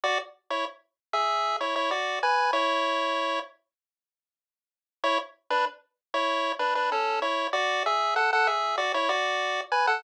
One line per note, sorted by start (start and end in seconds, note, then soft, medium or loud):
0.04 0.18 F#4 loud
0.04 0.18 D5 loud
0.50 0.65 E4 medium
0.50 0.65 C#5 medium
1.13 1.57 G#4 medium
1.13 1.57 E5 medium
1.61 1.75 E4 medium
1.61 1.75 C#5 medium
1.76 1.90 E4 medium
1.76 1.90 C#5 medium
1.91 2.19 F#4 medium
1.91 2.19 D5 medium
2.23 2.51 B4 medium
2.23 2.51 G#5 loud
2.53 3.40 E4 loud
2.53 3.40 C#5 loud
5.04 5.18 E4 loud
5.04 5.18 C#5 loud
5.50 5.65 D4 medium
5.50 5.65 B4 loud
6.14 6.52 E4 medium
6.14 6.52 C#5 loud
6.59 6.74 D4 medium
6.59 6.74 B4 medium
6.75 6.90 D4 medium
6.75 6.90 B4 medium
6.92 7.20 C#4 medium
6.92 7.20 A4 medium
7.22 7.48 E4 medium
7.22 7.48 C#5 medium
7.53 7.83 F#4 loud
7.53 7.83 D5 loud
7.86 8.15 G#4 medium
7.86 8.15 E5 medium
8.16 8.31 A4 medium
8.16 8.31 F#5 medium
8.33 8.48 A4 medium
8.33 8.48 F#5 loud
8.47 8.76 G#4 medium
8.47 8.76 E5 medium
8.78 8.92 F#4 medium
8.78 8.92 D5 loud
8.94 9.09 E4 medium
8.94 9.09 C#5 loud
9.09 9.61 F#4 medium
9.09 9.61 D5 loud
9.72 9.86 B4 medium
9.72 9.86 G#5 loud
9.87 10.02 A4 medium
9.87 10.02 F#5 loud